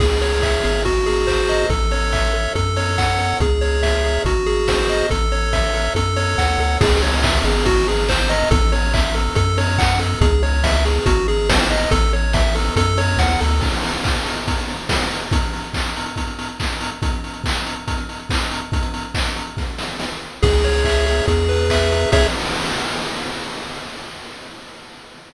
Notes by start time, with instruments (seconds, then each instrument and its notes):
0.00 synth bass 1 C#2, lead 1 (square) G#4, kick, crash
0.21 lead 1 (square) C#5, open hi-hat
0.42 lead 1 (square) E5, kick, clap
0.64 synth bass 1 G#1, lead 1 (square) G#4, open hi-hat
0.85 lead 1 (square) F#4, kick, closed hi-hat
1.06 lead 1 (square) G#4, open hi-hat
1.27 lead 1 (square) C5, kick, clap
1.49 lead 1 (square) D#5, open hi-hat
1.70 synth bass 1 A1, lead 1 (square) A4, kick, closed hi-hat
1.91 lead 1 (square) C#5, open hi-hat
2.13 lead 1 (square) E5, kick, clap
2.34 lead 1 (square) A4, open hi-hat
2.55 synth bass 1 F#2, lead 1 (square) A4, kick, closed hi-hat
2.76 lead 1 (square) C#5, open hi-hat
2.98 lead 1 (square) F#5, kick, clap
3.19 lead 1 (square) A4, open hi-hat
3.40 synth bass 1 C#2, lead 1 (square) G#4, kick, closed hi-hat
3.61 lead 1 (square) C#5, open hi-hat
3.83 lead 1 (square) E5, kick, snare
4.04 lead 1 (square) G#4, open hi-hat
4.25 synth bass 1 G#1, lead 1 (square) F#4, kick, closed hi-hat
4.46 lead 1 (square) G#4, open hi-hat
4.68 lead 1 (square) C5, kick, snare
4.89 lead 1 (square) D#5, open hi-hat
5.10 synth bass 1 A1, lead 1 (square) A4, kick, closed hi-hat
5.32 lead 1 (square) C#5, open hi-hat
5.53 lead 1 (square) E5, kick, snare
5.74 lead 1 (square) A4, open hi-hat
5.95 synth bass 1 F#2, lead 1 (square) A4, kick, closed hi-hat
6.16 lead 1 (square) C#5, open hi-hat
6.38 synth bass 1 D#2, lead 1 (square) F#5, kick, snare
6.59 synth bass 1 D2, lead 1 (square) A4, open hi-hat
6.81 synth bass 1 C#2, lead 1 (square) G#4, kick, crash
7.02 lead 1 (square) C#5, open hi-hat
7.23 lead 1 (square) E5, kick, clap
7.44 synth bass 1 G#1, lead 1 (square) G#4, open hi-hat
7.66 lead 1 (square) F#4, kick, closed hi-hat
7.87 lead 1 (square) G#4, open hi-hat
8.09 lead 1 (square) C5, kick, clap
8.29 lead 1 (square) D#5, open hi-hat
8.51 synth bass 1 A1, lead 1 (square) A4, kick, closed hi-hat
8.72 lead 1 (square) C#5, open hi-hat
8.94 lead 1 (square) E5, kick, clap
9.15 lead 1 (square) A4, open hi-hat
9.35 synth bass 1 F#2, lead 1 (square) A4, kick, closed hi-hat
9.58 lead 1 (square) C#5, open hi-hat
9.78 lead 1 (square) F#5, kick, clap
9.99 lead 1 (square) A4, open hi-hat
10.21 synth bass 1 C#2, lead 1 (square) G#4, kick, closed hi-hat
10.43 lead 1 (square) C#5, open hi-hat
10.64 lead 1 (square) E5, kick, snare
10.85 lead 1 (square) G#4, open hi-hat
11.06 synth bass 1 G#1, lead 1 (square) F#4, kick, closed hi-hat
11.28 lead 1 (square) G#4, open hi-hat
11.49 lead 1 (square) C5, kick, snare
11.70 lead 1 (square) D#5, open hi-hat
11.91 synth bass 1 A1, lead 1 (square) A4, kick, closed hi-hat
12.13 lead 1 (square) C#5, open hi-hat
12.33 lead 1 (square) E5, kick, snare
12.55 lead 1 (square) A4, open hi-hat
12.76 synth bass 1 F#2, lead 1 (square) A4, kick, closed hi-hat
12.98 lead 1 (square) C#5, open hi-hat
13.18 synth bass 1 D#2, lead 1 (square) F#5, kick, snare
13.41 synth bass 1 D2, lead 1 (square) A4, open hi-hat
13.61 kick, crash
13.73 closed hi-hat
13.83 open hi-hat
13.93 closed hi-hat
14.04 kick, clap
14.15 closed hi-hat
14.26 open hi-hat
14.37 closed hi-hat
14.48 kick, closed hi-hat
14.58 closed hi-hat
14.68 open hi-hat
14.79 closed hi-hat
14.89 kick, snare
15.01 closed hi-hat
15.11 open hi-hat
15.22 closed hi-hat
15.31 kick, closed hi-hat
15.42 closed hi-hat
15.53 open hi-hat
15.64 closed hi-hat
15.74 kick, clap
15.86 closed hi-hat
15.96 open hi-hat
16.06 closed hi-hat
16.16 kick, closed hi-hat
16.27 closed hi-hat
16.39 open hi-hat
16.49 closed hi-hat
16.60 kick, clap
16.70 closed hi-hat
16.81 open hi-hat
16.91 closed hi-hat
17.02 kick, closed hi-hat
17.13 closed hi-hat
17.24 open hi-hat
17.34 closed hi-hat
17.44 kick, clap
17.55 closed hi-hat
17.66 open hi-hat
17.76 closed hi-hat
17.88 kick, closed hi-hat
17.98 closed hi-hat
18.09 open hi-hat
18.19 closed hi-hat
18.30 kick, clap
18.40 closed hi-hat
18.51 open hi-hat
18.62 closed hi-hat
18.72 kick, closed hi-hat
18.83 closed hi-hat
18.94 open hi-hat
19.05 closed hi-hat
19.14 kick, clap
19.26 closed hi-hat
19.36 open hi-hat
19.47 closed hi-hat
19.57 kick, snare
19.78 snare
20.00 snare
20.42 synth bass 1 C#2, lead 1 (square) G#4, kick, crash
20.64 lead 1 (square) C#5, open hi-hat
20.84 lead 1 (square) E5, kick, clap
21.06 lead 1 (square) G#4, open hi-hat
21.28 synth bass 1 E2, lead 1 (square) G#4, kick, closed hi-hat
21.49 lead 1 (square) B4, open hi-hat
21.70 lead 1 (square) E5, kick, clap
21.91 lead 1 (square) G#4, open hi-hat
22.12 synth bass 1 C#2, lead 1 (square) G#4 C#5 E5, kick, crash